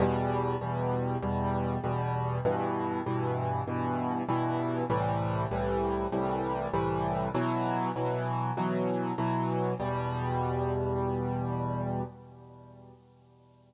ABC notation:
X:1
M:4/4
L:1/8
Q:1/4=98
K:Em
V:1 name="Acoustic Grand Piano" clef=bass
[E,,B,,G,]2 [E,,B,,G,]2 [E,,B,,G,]2 [E,,B,,G,]2 | [G,,B,,E,]2 [G,,B,,E,]2 [G,,B,,E,]2 [G,,B,,E,]2 | [C,,A,,E,G,]2 [C,,A,,E,G,]2 [C,,A,,E,G,]2 [C,,A,,E,G,]2 | [B,,E,F,]2 [B,,E,F,]2 [B,,E,F,]2 [B,,E,F,]2 |
[E,,B,,G,]8 |]